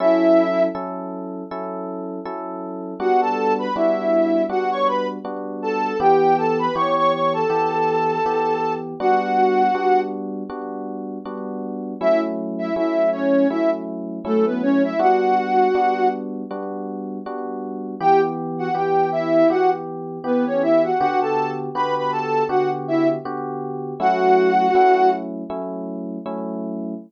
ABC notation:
X:1
M:4/4
L:1/16
Q:"Swing 16ths" 1/4=80
K:F#phr
V:1 name="Ocarina"
[Ee]4 z12 | [Ff] [Aa]2 [Bb] [Ee]4 [Ff] [cc'] [Bb] z3 [Aa]2 | [Gg]2 [Aa] [Bb] [cc'] [cc'] [cc'] [Aa]9 | [Ff]6 z10 |
[Ee] z2 [Ee] [Ee]2 [Cc]2 [Ee] z3 [A,A] [B,B] [Cc] [Ee] | [Ff]6 z10 | [Gg] z2 [Ff] [Gg]2 [Ee]2 [Ff] z3 [B,B] [Cc] [Ee] [Ff] | [Ff] [Aa]2 z [Bb] [Bb] [Aa]2 [Ff] z [Ee] z5 |
[Ff]6 z10 |]
V:2 name="Electric Piano 1"
[F,CEA]4 [F,CEA]4 [F,CEA]4 [F,CEA]4 | [G,B,DF]4 [G,B,DF]4 [G,B,DF]4 [G,B,DF]4 | [E,B,G]4 [E,B,G]4 [E,B,G]4 [E,B,G]4 | [G,B,DF]4 [G,B,DF]4 [G,B,DF]4 [G,B,DF]4 |
[F,A,CE]4 [F,A,CE]4 [F,A,CE]4 [F,A,CE]4 | [G,B,DF]4 [G,B,DF]4 [G,B,DF]4 [G,B,DF]4 | [E,B,G]4 [E,B,G]4 [E,B,G]4 [E,B,G]4 | [D,B,FG]4 [D,B,FG]4 [D,B,FG]4 [D,B,FG]4 |
[F,A,CE]4 [F,A,CE]4 [F,A,CE]4 [F,A,CE]4 |]